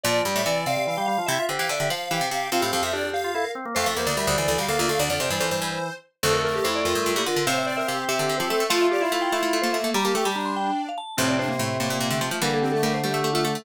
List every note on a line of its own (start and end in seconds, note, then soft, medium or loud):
0.03 0.21 A#2 loud
0.03 0.23 F3 medium
0.03 0.22 D5 medium
0.03 0.42 D5 loud
0.25 0.35 G2 medium
0.25 0.42 G3 medium
0.36 0.45 A2 loud
0.36 0.46 E5 medium
0.46 0.65 C3 loud
0.46 0.65 E3 medium
0.46 0.65 D5 medium
0.46 0.66 D5 medium
0.66 1.05 C3 medium
0.66 0.76 C3 medium
0.66 0.85 D5 loud
0.66 0.85 F5 medium
0.77 0.87 C3 medium
0.85 0.97 E3 medium
0.85 0.95 D5 medium
0.85 1.07 F5 medium
0.97 1.07 G3 medium
0.97 1.07 G5 medium
1.06 1.18 G3 medium
1.06 1.25 F5 loud
1.06 1.26 F5 medium
1.18 1.28 F3 medium
1.26 1.38 C3 loud
1.26 1.38 E4 medium
1.26 1.43 E5 loud
1.26 1.45 E5 medium
1.38 1.48 F4 medium
1.49 1.59 D3 medium
1.49 1.59 G4 medium
1.49 1.67 C5 medium
1.59 1.69 E3 loud
1.59 1.69 G4 medium
1.59 1.69 F5 medium
1.69 1.79 D3 loud
1.69 1.87 D5 loud
1.69 1.90 E5 medium
1.80 1.90 D3 medium
1.80 1.90 G4 medium
1.90 2.09 F3 loud
1.90 2.28 C5 medium
1.90 2.10 F5 medium
2.10 2.21 E3 loud
2.10 2.29 G4 medium
2.10 2.28 F5 medium
2.21 2.31 C3 medium
2.31 2.50 C3 medium
2.31 2.48 G4 medium
2.31 2.49 F5 medium
2.52 2.62 C3 loud
2.52 2.91 C4 medium
2.52 2.62 F4 loud
2.52 2.82 F5 medium
2.61 2.72 A2 medium
2.61 2.71 G4 medium
2.73 2.82 F2 loud
2.73 2.83 G4 medium
2.83 3.46 F2 medium
2.83 2.92 E5 medium
2.93 3.10 D4 medium
2.93 3.03 G4 loud
2.93 3.10 D5 medium
3.04 3.13 G4 medium
3.13 3.31 G4 loud
3.13 3.51 F5 medium
3.24 3.34 F4 medium
3.34 3.44 E4 medium
3.34 3.45 A4 medium
3.45 3.54 A#4 medium
3.55 3.65 C4 medium
3.65 3.75 A#3 medium
3.75 3.86 F2 loud
3.75 3.94 A3 medium
3.75 3.85 C5 loud
3.75 3.87 F5 medium
3.86 3.96 F2 medium
3.86 3.97 A4 loud
3.86 3.96 E5 medium
3.96 4.06 E2 medium
3.96 4.14 A#3 medium
3.96 4.08 A#4 medium
3.96 4.06 C5 medium
4.06 4.16 D2 loud
4.06 4.16 D5 medium
4.17 4.27 D2 medium
4.17 4.37 G3 medium
4.17 4.27 A#4 medium
4.17 4.27 E5 medium
4.27 4.37 D2 loud
4.27 4.37 C5 medium
4.27 4.37 D5 medium
4.38 4.47 D2 medium
4.38 4.47 E3 medium
4.38 4.48 C5 medium
4.38 4.47 D5 medium
4.48 4.58 D2 loud
4.48 4.58 E3 medium
4.48 4.57 A4 medium
4.48 4.57 D5 medium
4.58 4.68 D2 medium
4.58 4.68 G3 medium
4.58 4.68 F5 medium
4.68 4.78 D2 medium
4.68 4.78 A#3 medium
4.68 4.78 A4 loud
4.68 4.79 F5 medium
4.79 4.88 D2 loud
4.79 4.89 A#3 medium
4.79 4.89 F4 loud
4.79 4.88 D5 medium
4.89 4.99 D2 medium
4.89 4.99 A3 medium
4.89 4.99 A4 loud
4.89 4.99 F5 medium
4.99 5.09 D2 loud
4.99 5.09 D3 medium
4.99 5.09 D5 medium
4.99 5.18 D5 loud
5.10 5.19 F2 medium
5.10 5.20 D3 medium
5.10 5.20 D5 medium
5.20 5.30 F2 loud
5.20 5.30 C3 medium
5.20 5.30 C5 medium
5.20 5.32 D5 medium
5.30 5.40 G2 loud
5.30 5.90 E3 medium
5.30 5.74 C5 medium
5.30 5.41 D5 medium
5.40 5.50 F2 loud
5.40 5.50 C5 medium
5.51 5.61 G2 medium
5.51 5.93 C5 medium
5.62 5.79 G2 medium
6.23 6.60 D2 loud
6.23 6.60 F2 loud
6.23 7.23 A3 medium
6.23 6.42 A4 medium
6.23 6.34 C5 loud
6.33 6.43 A#4 loud
6.43 6.53 A4 medium
6.43 6.54 A#4 medium
6.54 6.64 G4 medium
6.54 6.64 A#4 medium
6.64 6.84 F2 loud
6.64 6.82 E4 medium
6.64 6.74 C5 loud
6.76 6.85 D5 loud
6.84 6.95 F2 medium
6.84 7.11 F4 medium
6.84 7.15 A#4 loud
6.95 7.05 G2 medium
7.06 7.16 G2 loud
7.15 7.26 A#2 loud
7.15 7.25 E4 medium
7.15 7.26 G4 loud
7.26 7.36 D3 loud
7.26 7.46 F4 medium
7.26 7.45 A#4 loud
7.36 7.46 D3 loud
7.47 7.83 A2 medium
7.47 7.83 C3 loud
7.47 8.63 C4 medium
7.47 7.65 C5 medium
7.47 7.57 F5 loud
7.58 7.67 E5 loud
7.66 7.76 D5 medium
7.66 7.78 D5 loud
7.77 7.87 A#4 medium
7.77 7.87 E5 loud
7.87 8.05 C3 medium
7.87 8.04 G4 medium
7.87 7.97 F5 medium
7.99 8.09 G5 loud
8.08 8.18 C3 loud
8.08 8.35 G4 medium
8.08 8.37 E5 loud
8.19 8.29 D3 loud
8.29 8.39 D3 medium
8.38 8.50 F3 loud
8.38 8.49 G4 medium
8.38 8.48 C5 loud
8.50 8.60 A3 loud
8.50 8.69 A4 medium
8.50 8.67 E5 medium
8.60 8.70 A3 loud
8.70 9.06 F3 loud
8.70 9.06 A3 loud
8.70 8.87 F4 loud
8.70 9.77 F4 loud
8.70 8.79 F5 loud
8.81 8.91 E5 medium
8.91 9.01 G4 medium
8.91 9.03 D5 loud
9.01 9.11 E4 medium
9.01 9.12 E5 loud
9.12 9.29 A3 loud
9.12 9.32 E4 medium
9.12 9.22 F5 loud
9.22 9.31 G5 loud
9.32 9.42 A3 medium
9.32 9.59 E4 medium
9.32 9.61 E5 loud
9.43 9.52 A3 medium
9.53 9.63 A3 loud
9.62 9.73 A3 medium
9.62 9.73 A#3 medium
9.62 9.72 C5 loud
9.73 9.83 A3 medium
9.73 9.92 A#3 medium
9.73 9.90 E5 loud
9.84 9.94 A3 medium
9.94 10.04 G3 loud
9.94 10.04 G3 medium
9.94 10.14 G4 medium
9.94 10.05 A#5 loud
10.05 10.14 G3 medium
10.05 10.14 A#3 medium
10.05 10.15 A5 medium
10.15 10.25 A3 medium
10.15 10.25 A3 loud
10.15 10.24 G4 medium
10.15 10.27 G5 medium
10.25 10.35 G3 medium
10.25 10.72 G3 medium
10.25 10.36 G4 medium
10.25 10.36 A5 loud
10.35 10.71 G3 medium
10.35 10.90 D4 medium
10.35 10.45 A#5 medium
10.46 10.55 C6 medium
10.56 10.82 G5 loud
10.89 10.98 F5 loud
10.98 11.16 A5 loud
11.17 11.54 F2 loud
11.17 11.54 A2 loud
11.17 12.29 C3 medium
11.17 11.36 C4 medium
11.17 11.29 C5 loud
11.28 11.38 D5 medium
11.39 11.49 D4 medium
11.39 11.98 C5 loud
11.48 11.58 A#3 medium
11.59 11.78 A2 loud
11.59 11.77 A3 medium
11.80 11.90 A2 medium
11.80 12.09 A#3 medium
11.90 12.00 A#2 medium
12.00 12.10 A#2 loud
12.10 12.20 D3 loud
12.10 12.20 A3 medium
12.21 12.31 F3 loud
12.21 12.38 A3 medium
12.31 12.41 F3 loud
12.41 13.57 D3 medium
12.41 12.78 E3 loud
12.41 12.78 G3 loud
12.41 12.59 A#3 medium
12.41 12.52 A#4 loud
12.54 12.64 A4 loud
12.62 12.71 C4 medium
12.62 12.73 G4 medium
12.72 12.82 A3 medium
12.72 12.82 A4 loud
12.83 13.00 G3 loud
12.83 13.01 A3 medium
12.83 12.93 A#4 loud
12.94 13.04 C5 loud
13.03 13.13 G3 medium
13.03 13.30 A3 medium
13.03 13.30 G4 loud
13.14 13.24 A3 medium
13.24 13.34 A3 loud
13.34 13.44 A3 loud
13.34 13.44 A3 medium
13.34 13.43 F4 loud
13.44 13.54 A3 loud
13.44 13.61 A3 medium
13.44 13.63 A4 loud
13.55 13.65 A3 medium